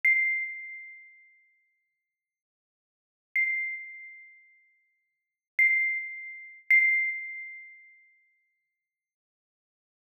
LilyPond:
\new Staff { \time 6/8 \tempo 4. = 36 c''''2. | c''''2 c''''4 | c''''2. | }